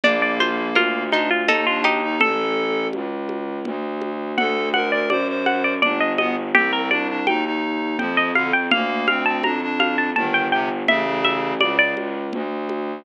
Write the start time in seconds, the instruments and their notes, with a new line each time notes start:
0.03 violin A#1, clarinet A#3, harpsichord D4 D5, low conga
0.22 harpsichord D5
0.40 harpsichord F4 C5, high conga
0.75 violin D2, harpsichord F4 A#4, high conga
1.12 clarinet D4, harpsichord D#4 F4, high conga
1.30 harpsichord F4
1.48 violin D#2, clarinet D#4, harpsichord D#4 A4, low conga
1.66 clarinet D4, harpsichord F4
1.84 harpsichord D#4 G4, high conga
2.03 clarinet D#4
2.19 violin A1, harpsichord A4, clarinet A4, low conga
2.93 violin C#2, high conga
3.29 high conga
3.65 violin D2, low conga
4.02 high conga
4.36 violin D2, clarinet A4, harpsichord F#5, low conga
4.74 clarinet A#4, harpsichord F#5, high conga
4.92 clarinet A#4, harpsichord D5
5.10 violin F#2, clarinet C5, harpsichord D5, high conga
5.28 clarinet C5
5.46 harpsichord F#5, high conga
5.64 harpsichord D5
5.82 violin G1, clarinet D4, harpsichord D5, low conga
6.00 harpsichord D#5
6.18 clarinet B3, harpsichord D#5, high conga
6.54 violin C2, clarinet C4, harpsichord G4, low conga
6.73 harpsichord A#4
6.91 clarinet D4, harpsichord D5, high conga
7.09 clarinet D4
7.27 violin D#2, clarinet D#4, harpsichord G5, high conga
7.45 clarinet D#4
7.99 violin F2, clarinet F3, harpsichord G5, low conga
8.17 harpsichord D#5
8.35 clarinet D3, harpsichord F5, high conga
8.53 harpsichord G5
8.71 violin D2, clarinet A#3, harpsichord F5, low conga
9.08 clarinet C4, harpsichord F5, high conga
9.26 clarinet C4, harpsichord A5
9.43 violin F2, clarinet D4, harpsichord A#5, high conga
9.62 clarinet D4
9.80 harpsichord F5, high conga
9.98 harpsichord A5
10.16 violin G1, clarinet D#3, harpsichord A5, low conga
10.34 harpsichord G5
10.52 clarinet C3, harpsichord G5
10.88 violin A1, clarinet C#3, harpsichord E5, low conga
11.24 harpsichord E5, high conga
11.61 violin C#2, clarinet C#3, harpsichord D5, high conga
11.79 harpsichord D5
11.97 high conga
12.33 violin D2, low conga
12.69 high conga